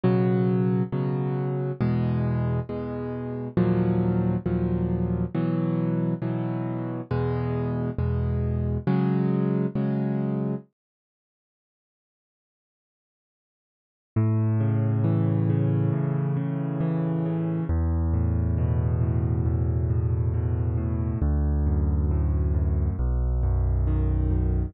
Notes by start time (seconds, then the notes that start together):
0.03 B2 C#3 F#3
0.92 B2 C#3 F#3
1.81 E2 B2 G#3
2.69 E2 B2 G#3
3.57 D#2 A#2 F3 F#3
4.46 D#2 A#2 F3 F#3
5.35 B2 E3 F#3
6.22 B2 E3 F#3
7.11 E2 B2 G#3
7.98 E2 B2 G#3
8.87 C#3 F#3 G#3
9.75 C#3 F#3 G#3
14.16 A2
14.60 C#3
15.04 E3
15.49 C#3
15.92 A2
16.37 C#3
16.81 E3
17.25 C#3
17.69 E2
18.14 A2
18.58 B2
19.01 A2
19.46 E2
19.90 A2
20.34 B2
20.77 A2
21.22 D2
21.66 F#2
22.11 A2
22.54 F#2
22.99 B1
23.43 F#2
23.87 D#3
24.31 F#2